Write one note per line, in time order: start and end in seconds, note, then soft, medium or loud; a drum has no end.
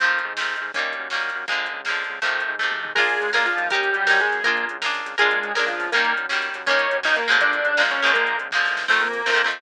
0.00 0.20 F2 medium
0.00 0.33 D#3 medium
0.00 0.33 F3 medium
0.00 0.33 A3 medium
0.00 0.33 C4 medium
0.00 kick medium
0.00 closed hi-hat medium
0.19 closed hi-hat medium
0.25 0.56 G#2 medium
0.37 0.71 F3 medium
0.37 0.71 A3 medium
0.37 0.71 C4 medium
0.37 snare loud
0.41 0.71 D#3 medium
0.56 closed hi-hat medium
0.61 0.72 G#2 medium
0.74 0.95 D#2 medium
0.74 1.08 G3 medium
0.74 1.08 A#3 medium
0.74 1.08 C#4 medium
0.74 kick medium
0.74 closed hi-hat medium
0.78 1.08 D#3 medium
0.93 closed hi-hat medium
0.99 1.31 F#2 medium
1.10 1.45 G3 medium
1.10 1.45 A#3 medium
1.10 1.45 C#4 medium
1.10 snare medium
1.15 1.45 D#3 medium
1.29 closed hi-hat medium
1.35 1.46 F#2 medium
1.48 1.69 A#1 medium
1.48 1.81 D3 medium
1.48 1.81 F3 medium
1.48 1.81 G#3 medium
1.48 1.81 A#3 medium
1.48 kick medium
1.48 closed hi-hat medium
1.66 closed hi-hat medium
1.73 2.04 C#2 medium
1.85 2.19 F3 medium
1.85 2.19 G#3 medium
1.85 2.19 A#3 medium
1.85 snare medium
1.90 2.19 D3 medium
2.04 closed hi-hat medium
2.09 2.20 C#2 medium
2.22 2.43 F2 medium
2.22 2.55 C3 medium
2.22 2.55 D#3 medium
2.22 2.55 F3 medium
2.22 2.55 A3 medium
2.22 kick medium
2.22 closed hi-hat medium
2.40 closed hi-hat medium
2.48 2.80 G#2 medium
2.59 2.93 C3 medium
2.59 2.93 D#3 medium
2.59 2.93 F3 medium
2.59 2.93 A3 medium
2.59 kick medium
2.59 snare medium
2.71 high tom medium
2.83 2.94 G#2 medium
2.83 mid tom loud
2.95 3.17 A#1 medium
2.95 3.31 G#3 medium
2.95 3.29 F4 loud
2.95 3.31 G#4 loud
2.95 3.29 G#4 loud
2.95 3.29 A#4 loud
2.95 kick loud
2.95 crash medium
2.99 3.29 D4 medium
3.09 closed hi-hat medium
3.21 3.53 C#2 medium
3.21 closed hi-hat medium
3.33 3.46 A#3 medium
3.33 3.66 D4 medium
3.33 3.66 F4 medium
3.33 3.66 G#4 medium
3.33 3.66 A#4 medium
3.33 3.46 A#4 medium
3.33 snare medium
3.45 3.68 F3 medium
3.45 3.68 F4 medium
3.45 closed hi-hat medium
3.57 3.90 D#2 medium
3.57 closed hi-hat medium
3.70 4.20 G3 medium
3.70 4.04 D#4 loud
3.70 4.20 G4 loud
3.70 4.04 G4 medium
3.70 4.04 A#4 medium
3.70 kick loud
3.70 closed hi-hat medium
3.74 4.04 C#4 loud
3.83 closed hi-hat medium
3.94 4.26 F#2 medium
3.94 closed hi-hat medium
4.07 4.40 D#4 medium
4.07 4.40 G4 medium
4.07 4.40 A#4 medium
4.07 snare loud
4.11 4.40 C#4 medium
4.20 4.43 G#3 medium
4.20 4.43 G#4 medium
4.20 closed hi-hat medium
4.32 4.42 F#2 medium
4.32 closed hi-hat medium
4.44 4.65 A#1 medium
4.44 4.65 A#3 medium
4.44 4.77 F4 loud
4.44 4.77 G#4 medium
4.44 4.65 A#4 loud
4.44 4.77 A#4 medium
4.44 kick medium
4.44 closed hi-hat medium
4.48 4.77 D4 medium
4.57 closed hi-hat medium
4.69 5.02 C#2 medium
4.69 closed hi-hat medium
4.82 5.15 F4 medium
4.82 5.15 G#4 medium
4.82 5.15 A#4 medium
4.82 snare loud
4.86 5.15 D4 medium
4.94 closed hi-hat medium
5.05 5.16 C#2 medium
5.05 closed hi-hat medium
5.18 5.40 A#1 medium
5.18 5.53 G#3 medium
5.18 5.51 D4 loud
5.18 5.51 F4 loud
5.18 5.53 G#4 medium
5.18 5.51 G#4 loud
5.18 5.51 A#4 loud
5.18 kick medium
5.18 closed hi-hat medium
5.31 closed hi-hat medium
5.43 5.75 C#2 medium
5.43 closed hi-hat medium
5.55 5.68 A#3 medium
5.55 5.89 D4 medium
5.55 5.89 F4 medium
5.55 5.89 G#4 medium
5.55 5.89 A#4 medium
5.55 5.68 A#4 medium
5.55 snare loud
5.67 5.90 F3 medium
5.67 5.90 F4 medium
5.67 closed hi-hat medium
5.79 5.90 C#2 medium
5.79 open hi-hat medium
5.92 6.13 D#2 medium
5.92 6.26 G3 medium
5.92 6.13 A#3 medium
5.92 6.26 A#3 loud
5.92 6.26 C#4 loud
5.92 6.13 A#4 loud
5.92 kick medium
5.92 closed hi-hat loud
5.97 6.26 D#3 medium
6.05 closed hi-hat medium
6.17 6.49 F#2 medium
6.17 closed hi-hat medium
6.29 6.63 D#3 medium
6.29 6.63 G3 medium
6.29 6.63 A#3 medium
6.29 6.63 C#4 medium
6.29 snare medium
6.42 closed hi-hat medium
6.54 6.66 F#2 medium
6.54 closed hi-hat medium
6.66 6.87 D#2 medium
6.66 7.00 G3 medium
6.66 7.00 A#3 loud
6.66 7.00 C#4 loud
6.66 6.97 C#4 medium
6.66 6.97 C#5 loud
6.66 kick medium
6.66 closed hi-hat medium
6.71 7.00 D#3 loud
6.79 closed hi-hat medium
6.91 7.23 F#2 medium
6.91 closed hi-hat medium
7.03 7.27 D#3 medium
7.03 7.27 G3 medium
7.03 7.27 A#3 medium
7.03 7.27 C#4 medium
7.03 7.16 D#4 medium
7.03 7.16 D#5 loud
7.03 snare loud
7.16 7.36 A#3 medium
7.16 7.36 A#4 medium
7.16 closed hi-hat medium
7.28 7.39 F#2 medium
7.28 7.73 D3 medium
7.28 7.73 F3 loud
7.28 7.73 G#3 loud
7.28 7.73 A#3 loud
7.28 closed hi-hat medium
7.40 7.61 A#1 medium
7.40 7.82 D4 medium
7.40 7.82 D5 loud
7.40 kick medium
7.40 closed hi-hat medium
7.53 closed hi-hat medium
7.65 7.97 C#2 medium
7.65 closed hi-hat medium
7.77 8.01 F3 medium
7.77 8.01 G#3 medium
7.77 8.01 A#3 medium
7.77 snare loud
7.81 8.01 D3 medium
7.91 8.11 C#4 medium
7.91 8.11 C#5 medium
7.91 closed hi-hat medium
8.02 8.14 C#2 medium
8.02 8.48 D3 loud
8.02 8.48 F3 medium
8.02 8.48 G#3 loud
8.02 8.48 A#3 medium
8.02 closed hi-hat medium
8.14 8.36 A#1 medium
8.14 8.37 A#3 medium
8.14 8.37 A#4 medium
8.14 kick medium
8.14 closed hi-hat medium
8.27 closed hi-hat medium
8.39 8.51 C#2 medium
8.39 closed hi-hat medium
8.51 8.68 D#2 medium
8.51 8.86 F3 medium
8.51 8.86 G#3 medium
8.51 8.86 A#3 medium
8.51 kick medium
8.51 snare medium
8.56 8.86 D3 medium
8.65 snare medium
8.71 8.88 E2 medium
8.77 snare medium
8.88 9.22 F2 medium
8.88 9.08 D#3 medium
8.88 9.08 F3 medium
8.88 9.08 A3 medium
8.88 9.00 A3 medium
8.88 9.08 C4 medium
8.88 9.00 A4 loud
8.88 kick medium
8.88 crash medium
9.00 9.46 A#3 medium
9.00 9.46 A#4 medium
9.00 closed hi-hat medium
9.13 closed hi-hat medium
9.26 9.60 F2 medium
9.26 9.33 D#3 medium
9.26 9.32 F3 medium
9.26 9.31 A3 medium
9.26 9.31 C4 medium
9.26 snare loud
9.32 9.42 D#3 medium
9.32 9.42 F3 medium
9.32 9.42 A3 medium
9.32 9.42 C4 medium
9.38 closed hi-hat medium
9.44 9.59 D#3 medium
9.44 9.59 F3 medium
9.44 9.59 A3 medium
9.44 9.59 C4 medium
9.51 closed hi-hat medium